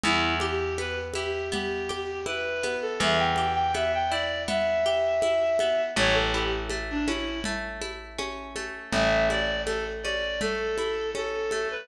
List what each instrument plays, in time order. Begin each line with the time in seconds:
0.04 electric bass (finger) E2, acoustic guitar (steel) B3, clarinet E4, low conga
0.40 clarinet G4, acoustic guitar (steel) G4, high conga
0.78 acoustic guitar (steel) B3, clarinet B4, high conga
1.14 acoustic guitar (steel) E4, clarinet G4, high conga
1.52 acoustic guitar (steel) B3, clarinet G4, low conga
1.89 acoustic guitar (steel) G4, high conga
2.26 acoustic guitar (steel) E4, clarinet B4, high conga
2.63 acoustic guitar (steel) B3, high conga
2.82 clarinet A4
3.00 electric bass (finger) E2, acoustic guitar (steel) B3, clarinet E5, low conga
3.19 clarinet G5
3.36 acoustic guitar (steel) G4, high conga
3.54 clarinet G5
3.74 acoustic guitar (steel) B3, clarinet E5, high conga
3.94 clarinet G5
4.10 acoustic guitar (steel) E4, clarinet D5
4.48 acoustic guitar (steel) B3, clarinet E5, low conga
4.86 acoustic guitar (steel) G4
5.22 acoustic guitar (steel) E4, high conga
5.59 acoustic guitar (steel) B3, high conga
5.96 electric bass (finger) A1, acoustic guitar (steel) A3, clarinet C#5, low conga
6.14 clarinet A4
6.34 acoustic guitar (steel) E4, clarinet G4
6.70 acoustic guitar (steel) A3, high conga
6.91 clarinet D4
7.06 acoustic guitar (steel) C#4, clarinet E4, high conga
7.44 acoustic guitar (steel) A3, low conga
7.81 acoustic guitar (steel) E4, high conga
8.19 acoustic guitar (steel) C#4, high conga
8.56 acoustic guitar (steel) A3, high conga
8.92 electric bass (finger) A1, acoustic guitar (steel) A3, clarinet E5, low conga
9.30 acoustic guitar (steel) E4, clarinet D5, high conga
9.66 acoustic guitar (steel) A3, clarinet A4, high conga
10.03 acoustic guitar (steel) C#4, clarinet D5, high conga
10.41 acoustic guitar (steel) A3, clarinet A4, low conga
10.78 acoustic guitar (steel) E4, high conga
11.15 acoustic guitar (steel) C#4, clarinet A4, high conga
11.51 acoustic guitar (steel) A3, high conga
11.71 clarinet B4